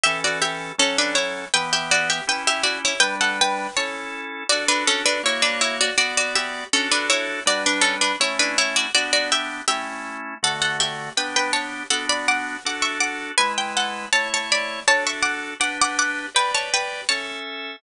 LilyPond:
<<
  \new Staff \with { instrumentName = "Harpsichord" } { \time 2/2 \key d \major \tempo 2 = 81 <g' e''>8 <fis' d''>8 <g' e''>4 <cis' a'>8 <d' b'>8 <e' cis''>4 | <b' g''>8 <g' e''>8 <fis' d''>8 <g' e''>8 <b' g''>8 <g' e''>8 <fis' d''>8 <e' cis''>8 | <b' g''>8 <a' fis''>8 <b' g''>4 <cis'' a''>4. r8 | <fis' d''>8 <d' b'>8 <cis' a'>8 <d' b'>8 <e' cis''>8 <d' b'>8 <e' cis''>8 <fis' d''>8 |
<fis' d''>8 <fis' d''>8 <g' e''>4 <cis' a'>8 <d' b'>8 <e' cis''>4 | <fis' d''>8 <d' b'>8 <cis' a'>8 <d' b'>8 <e' cis''>8 <d' b'>8 <e' cis''>8 <fis' d''>8 | <fis' d''>8 <fis' d''>8 <g' e''>4 <g' e''>4. r8 | <a' fis''>8 <a' fis''>8 <g' e''>4 <b' g''>8 <b' g''>8 <cis'' a''>4 |
<a' fis''>8 <d'' b''>8 <fis'' d'''>4 <fis'' d'''>8 <e'' cis'''>8 <fis'' d'''>4 | <b' gis''>8 g''8 <a' fis''>4 <cis'' a''>8 <cis'' a''>8 <d'' b''>4 | <cis'' a''>8 <e'' cis'''>8 <fis'' d'''>4 <fis'' d'''>8 <fis'' d'''>8 <fis'' d'''>4 | <b' g''>8 <cis'' a''>8 <b' g''>4 <cis'' a''>4 r4 | }
  \new Staff \with { instrumentName = "Drawbar Organ" } { \time 2/2 \key d \major <e cis' a'>2 <fis cis' a'>2 | <e b g'>2 <cis' e' g'>2 | <g d' b'>2 <cis' e' a'>2 | <d' fis' a'>2 <ais fis' cis''>2 |
<b fis' d''>2 <d' fis' a'>2 | <g d' b'>2 <a cis' e'>2 | <b d' g'>2 <a cis' e'>2 | <d a fis'>2 <b d' g'>2 |
<b d' fis'>2 <d' fis' a'>2 | <gis e' b'>2 <a e' cis''>2 | <d' fis' a'>2 <d' g' b'>2 | <g' b' d''>2 <cis' a' e''>2 | }
>>